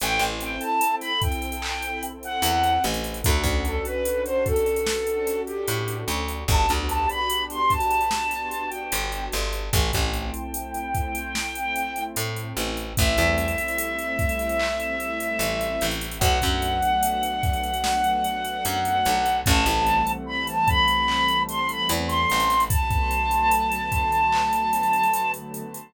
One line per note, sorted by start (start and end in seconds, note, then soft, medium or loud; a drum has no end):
0.00 0.19 A1 medium
0.00 1.46 C4 medium
0.00 1.46 E4 loud
0.00 1.46 A4 medium
0.00 0.21 G5 medium
0.00 closed hi-hat loud
0.19 0.56 A1 medium
0.19 closed hi-hat medium
0.41 0.61 G5 medium
0.41 closed hi-hat medium
0.60 0.93 A5 medium
0.60 closed hi-hat medium
0.81 closed hi-hat loud
1.01 1.20 B5 medium
1.01 snare soft
1.01 closed hi-hat medium
1.21 2.03 G5 medium
1.21 kick loud
1.21 closed hi-hat loud
1.32 closed hi-hat medium
1.42 closed hi-hat medium
1.52 closed hi-hat medium
1.62 3.08 C4 medium
1.62 3.08 E4 medium
1.62 3.08 A4 medium
1.62 clap loud
1.82 closed hi-hat medium
2.03 closed hi-hat loud
2.23 2.83 F#5 medium
2.23 closed hi-hat medium
2.42 2.79 E2 medium
2.42 closed hi-hat loud
2.64 closed hi-hat medium
2.84 3.21 A1 medium
2.84 closed hi-hat medium
2.94 closed hi-hat medium
3.04 closed hi-hat medium
3.14 closed hi-hat medium
3.22 3.43 D2 medium
3.22 4.70 C#4 medium
3.22 4.70 D4 medium
3.22 4.70 F#4 medium
3.22 3.42 A4 medium
3.22 4.70 A4 medium
3.22 kick loud
3.22 closed hi-hat loud
3.44 3.80 D2 medium
3.44 kick loud
3.44 closed hi-hat medium
3.65 3.84 A4 medium
3.65 closed hi-hat medium
3.85 4.21 B4 medium
3.85 closed hi-hat medium
4.05 closed hi-hat loud
4.24 4.44 C5 medium
4.24 closed hi-hat medium
4.45 5.40 A4 medium
4.45 kick loud
4.45 closed hi-hat medium
4.56 closed hi-hat medium
4.66 closed hi-hat medium
4.76 closed hi-hat medium
4.86 6.33 C#4 medium
4.86 6.33 D4 medium
4.86 6.33 F#4 medium
4.86 6.33 A4 medium
4.86 snare loud
5.07 closed hi-hat medium
5.27 snare soft
5.27 closed hi-hat loud
5.46 5.97 G4 medium
5.46 closed hi-hat medium
5.68 6.04 A2 medium
5.68 closed hi-hat loud
5.88 closed hi-hat medium
6.08 6.44 D2 medium
6.08 closed hi-hat loud
6.28 closed hi-hat medium
6.48 6.66 G1 medium
6.48 7.95 B3 medium
6.48 7.95 D4 loud
6.48 7.95 F#4 medium
6.48 7.95 G4 loud
6.48 6.70 A5 medium
6.48 kick loud
6.48 closed hi-hat loud
6.69 7.06 D2 medium
6.69 closed hi-hat medium
6.88 7.07 A5 medium
6.88 closed hi-hat loud
7.09 7.43 B5 medium
7.09 closed hi-hat medium
7.30 closed hi-hat loud
7.50 7.70 C6 medium
7.50 closed hi-hat medium
7.70 8.68 A5 medium
7.70 kick medium
7.70 closed hi-hat medium
7.80 closed hi-hat medium
7.91 closed hi-hat medium
8.01 closed hi-hat medium
8.11 9.57 B3 medium
8.11 9.57 D4 medium
8.11 9.57 F#4 medium
8.11 9.57 G4 medium
8.11 snare loud
8.31 snare soft
8.31 closed hi-hat medium
8.51 closed hi-hat medium
8.69 9.22 G5 medium
8.69 closed hi-hat medium
8.92 9.29 G1 medium
8.92 closed hi-hat loud
9.12 closed hi-hat medium
9.32 9.70 G1 medium
9.32 snare medium
9.32 closed hi-hat medium
9.53 closed hi-hat medium
9.73 9.91 A1 medium
9.73 11.19 A3 medium
9.73 11.19 C4 medium
9.73 11.19 E4 medium
9.73 12.02 G5 medium
9.73 kick loud
9.73 closed hi-hat loud
9.93 10.31 A1 medium
9.93 kick loud
9.93 closed hi-hat loud
10.14 closed hi-hat medium
10.34 closed hi-hat medium
10.54 closed hi-hat loud
10.74 closed hi-hat medium
10.95 kick loud
10.95 closed hi-hat medium
11.15 closed hi-hat loud
11.35 12.81 A3 medium
11.35 12.81 C4 medium
11.35 12.81 E4 medium
11.35 snare loud
11.55 closed hi-hat medium
11.76 closed hi-hat loud
11.96 closed hi-hat medium
12.16 12.53 A2 medium
12.16 closed hi-hat loud
12.36 closed hi-hat medium
12.57 12.93 A1 medium
12.57 snare soft
12.57 closed hi-hat loud
12.77 closed hi-hat medium
12.97 13.17 A1 medium
12.97 15.89 G3 medium
12.97 15.89 A3 loud
12.97 15.89 C4 medium
12.97 15.89 E4 loud
12.97 15.86 E5 medium
12.97 kick loud
12.97 closed hi-hat loud
13.18 13.54 E2 medium
13.18 closed hi-hat medium
13.38 closed hi-hat medium
13.48 closed hi-hat medium
13.58 closed hi-hat medium
13.68 closed hi-hat medium
13.78 closed hi-hat loud
13.99 closed hi-hat medium
14.19 kick loud
14.19 closed hi-hat medium
14.29 closed hi-hat medium
14.39 closed hi-hat medium
14.49 closed hi-hat medium
14.59 clap loud
14.80 closed hi-hat medium
15.00 closed hi-hat medium
15.20 closed hi-hat loud
15.39 15.76 A1 medium
15.39 closed hi-hat loud
15.61 closed hi-hat medium
15.81 16.18 A1 medium
15.81 closed hi-hat loud
15.91 closed hi-hat medium
16.01 closed hi-hat medium
16.11 closed hi-hat medium
16.19 16.39 B1 medium
16.19 19.14 F#3 loud
16.19 19.14 A3 medium
16.19 19.14 B3 medium
16.19 19.14 D4 loud
16.19 19.37 F#5 medium
16.19 kick loud
16.19 closed hi-hat loud
16.42 16.80 F#2 medium
16.42 kick medium
16.42 snare soft
16.42 closed hi-hat medium
16.62 closed hi-hat medium
16.82 closed hi-hat medium
17.03 closed hi-hat loud
17.23 closed hi-hat medium
17.43 kick loud
17.43 snare soft
17.43 closed hi-hat medium
17.53 closed hi-hat medium
17.64 closed hi-hat medium
17.74 closed hi-hat medium
17.84 snare loud
18.04 closed hi-hat medium
18.24 closed hi-hat medium
18.45 closed hi-hat medium
18.65 19.02 F#2 medium
18.65 closed hi-hat loud
18.85 closed hi-hat medium
19.05 19.43 B1 medium
19.05 closed hi-hat loud
19.26 closed hi-hat medium
19.44 19.65 A1 loud
19.44 22.38 E3 medium
19.44 22.38 G3 medium
19.44 22.38 A3 loud
19.44 22.38 C4 medium
19.44 20.10 A5 medium
19.44 kick loud
19.44 closed hi-hat loud
19.66 20.02 A1 medium
19.66 closed hi-hat loud
19.86 closed hi-hat medium
20.07 closed hi-hat medium
20.26 20.45 B5 medium
20.47 20.67 A5 medium
20.47 closed hi-hat medium
20.68 21.41 B5 medium
20.68 kick loud
20.68 closed hi-hat medium
20.88 closed hi-hat medium
21.08 clap loud
21.28 closed hi-hat medium
21.48 21.68 C6 medium
21.48 closed hi-hat loud
21.69 21.90 B5 medium
21.69 closed hi-hat medium
21.89 22.26 E2 medium
21.89 closed hi-hat loud
22.08 22.61 C6 medium
22.08 snare soft
22.08 closed hi-hat medium
22.30 22.68 A1 medium
22.30 closed hi-hat loud
22.40 closed hi-hat medium
22.50 closed hi-hat medium
22.60 closed hi-hat medium
22.69 25.62 D3 medium
22.69 25.62 F#3 loud
22.69 25.62 A3 medium
22.69 25.62 B3 medium
22.69 25.30 A5 medium
22.69 kick loud
22.69 closed hi-hat loud
22.91 kick loud
22.91 closed hi-hat medium
23.11 closed hi-hat medium
23.31 closed hi-hat medium
23.51 closed hi-hat loud
23.72 closed hi-hat medium
23.92 kick loud
23.92 closed hi-hat loud
24.12 closed hi-hat medium
24.32 clap loud
24.53 closed hi-hat medium
24.73 closed hi-hat loud
24.83 closed hi-hat medium
24.93 closed hi-hat medium
25.03 closed hi-hat medium
25.14 closed hi-hat loud
25.34 closed hi-hat medium
25.54 closed hi-hat medium
25.74 closed hi-hat medium